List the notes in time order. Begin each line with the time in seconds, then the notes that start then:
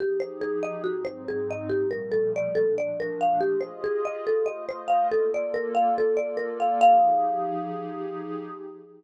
0.00 F3 D#4 G4 G#4
0.20 C5
0.41 G#4
0.63 D#5
0.84 G#2 F#3 C4 D#4 F#4
1.05 C5
1.28 G#4
1.51 D#5
1.70 A#2 F3 G3 A3 G4
1.91 A#4
2.12 A4
2.36 D5
2.55 A#2 F3 A3 D4 A4
2.78 D5
3.00 A#4
3.21 F5
3.40 F4 G4 G#4 D#5
3.61 C5
3.84 G#4
4.05 D#5
4.25 A3 F4 A4 C5 D#5
4.46 D#5
4.69 C5
4.88 F5
5.11 A#3 F4 A4 D5
5.34 D5
5.54 A#4
5.75 F5
5.96 A#3 F4 A4 D5
6.17 D5
6.37 A#4
6.60 F5
6.81 F3 D#4 G4 G#4 F5